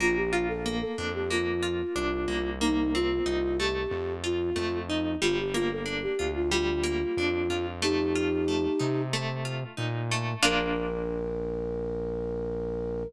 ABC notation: X:1
M:4/4
L:1/16
Q:1/4=92
K:Bb
V:1 name="Flute"
F G F A2 A2 G F8 | E2 F4 G4 F4 E2 | F G F A2 G2 F F8 | [EG]8 z8 |
B16 |]
V:2 name="Acoustic Guitar (steel)"
B,2 F2 B,2 D2 B,2 F2 D2 B,2 | B,2 C2 E2 A,4 F2 A,2 E2 | G,2 B,2 D2 F2 G,2 B,2 D2 F2 | A,2 F2 A,2 E2 A,2 F2 E2 A,2 |
[B,DF]16 |]
V:3 name="Synth Bass 1" clef=bass
B,,,6 F,,6 C,,2 C,,2- | C,,4 C,,4 F,,4 F,,4 | G,,,6 D,,6 F,,2 F,,2- | F,,6 C,6 B,,4 |
B,,,16 |]